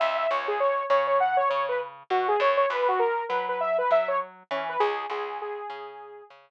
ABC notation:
X:1
M:4/4
L:1/16
Q:"Swing 16ths" 1/4=100
K:C#dor
V:1 name="Lead 2 (sawtooth)"
e e c G c2 c c f c c B z2 F G | c c B F A2 B B e B e c z2 C B | G2 G2 G6 z6 |]
V:2 name="Electric Bass (finger)" clef=bass
C,,2 C,,4 C,4 C,4 B,,2 | F,,2 F,,4 F,4 F,4 E,2 | C,,2 C,,4 C,4 C,4 z2 |]